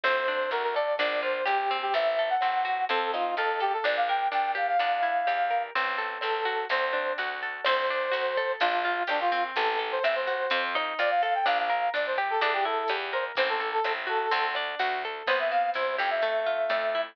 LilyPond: <<
  \new Staff \with { instrumentName = "Brass Section" } { \time 4/4 \key g \dorian \tempo 4 = 126 c''4 bes'16 bes'16 d''8 d''8 c''8 g'8. g'16 | e''8. fis''4~ fis''16 a'8 f'8 a'8 g'16 a'16 | d''16 f''16 g''8 g''8 f''16 f''2~ f''16 | r4 a'4 c''4 r4 |
c''2 f'4 d'16 f'8 r16 | a'8 r16 c''16 e''16 c''4~ c''16 r8 d''16 f''16 f''16 g''16 | f''16 f''8. d''16 c''16 r16 a'16 a'16 g'16 a'8. r16 c''16 r16 | c''16 a'8 a'8 r16 a'4 r4. |
c''16 e''16 f''8 c''8 g''16 e''2~ e''16 | }
  \new Staff \with { instrumentName = "Acoustic Guitar (steel)" } { \time 4/4 \key g \dorian c'8 d'8 fis'8 a'8 d'8 f'8 g'8 c'8~ | c'8 a'8 c'8 fis'8 c'8 ees'8 f'8 a'8 | d'8 bes'8 d'8 g'8 d'8 e'8 g'8 bes'8 | c'8 a'8 c'8 fis'8 c'8 d'8 fis'8 a'8 |
c'8 d'8 fis'8 a'8 d'8 f'8 g'8 c'8~ | c'8 a'8 c'8 fis'8 c'8 ees'8 f'8 a'8 | d'8 bes'8 d'8 g'8 d'8 e'8 g'8 bes'8 | c'8 a'8 c'8 fis'8 c'8 d'8 fis'8 a'8 |
b8 c'8 e'8 g'8 a8 f'8 a8 e'8 | }
  \new Staff \with { instrumentName = "Electric Bass (finger)" } { \clef bass \time 4/4 \key g \dorian d,4 d,4 bes,,4 bes,,4 | a,,4 a,,4 f,4 f,4 | bes,,4 bes,,4 e,4 e,4 | a,,4 a,,4 d,4 d,4 |
d,4 d,4 bes,,4 bes,,4 | a,,4 a,,4 f,4 f,4 | bes,,4 bes,,4 e,4 e,4 | a,,4 a,,4 d,4 d,4 |
c,4 c,8 f,4. f,4 | }
  \new DrumStaff \with { instrumentName = "Drums" } \drummode { \time 4/4 <cymc ss>8 bd8 hh8 <bd ss>8 <hh bd>4 <hh ss>8 bd8 | <hh bd>4 <hh ss>8 bd8 <hh bd>8 ss8 hh8 bd8 | <hh bd ss>4 hh8 <bd ss>8 <hh bd>4 <hh ss>8 bd8 | <hh bd>4 <hh ss>8 bd8 <hh bd>8 ss8 hh8 bd8 |
<cymc ss>8 bd8 hh8 <bd ss>8 <hh bd>4 <hh ss>8 bd8 | <hh bd>4 <hh ss>8 bd8 <hh bd>8 ss8 hh8 bd8 | <hh bd ss>4 hh8 <bd ss>8 <hh bd>4 <hh ss>8 bd8 | <hh bd>4 <hh ss>8 bd8 <hh bd>8 ss8 hh8 bd8 |
<hh bd ss>4 hh8 <bd ss>8 <hh bd>4 <hh ss>8 bd8 | }
>>